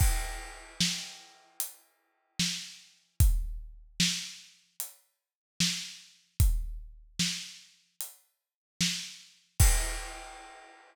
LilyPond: \new DrumStaff \drummode { \time 4/4 \tempo 4 = 75 <cymc bd>4 sn4 hh4 sn4 | <hh bd>4 sn4 hh4 sn4 | <hh bd>4 sn4 hh4 sn4 | <cymc bd>4 r4 r4 r4 | }